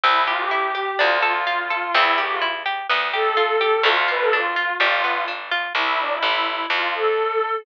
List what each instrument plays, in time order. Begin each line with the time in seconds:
0.03 electric bass (finger) C2, orchestral harp C4, violin E4
0.27 violin F4, orchestral harp G4
0.39 violin G4
0.51 orchestral harp E4, violin G4
0.75 orchestral harp G4
0.99 electric bass (finger) D2, orchestral harp D4, violin F4
1.22 violin F4, orchestral harp A4
1.47 orchestral harp F4
1.70 orchestral harp A4
1.94 electric bass (finger) E2, orchestral harp C4, violin E4
2.18 orchestral harp G4, violin G4
2.30 violin F4
2.41 orchestral harp E4
2.66 orchestral harp G4
2.89 electric bass (finger) D2, orchestral harp B3
3.13 orchestral harp G4, violin A4
3.37 orchestral harp F4
3.61 orchestral harp G4
3.83 electric bass (finger) D2, orchestral harp A3, violin F4
4.08 orchestral harp F4, violin B4
4.20 violin A4
4.32 orchestral harp D4, violin F4
4.56 orchestral harp F4
4.80 electric bass (finger) G1, orchestral harp G3, violin F4
5.04 orchestral harp B3
5.28 orchestral harp D4
5.51 orchestral harp F4
5.75 electric bass (finger) C2, violin E4
5.99 violin D4
6.11 violin E4
6.22 electric bass (finger) A1, violin E4
6.70 electric bass (finger) F2, violin F4
6.94 violin A4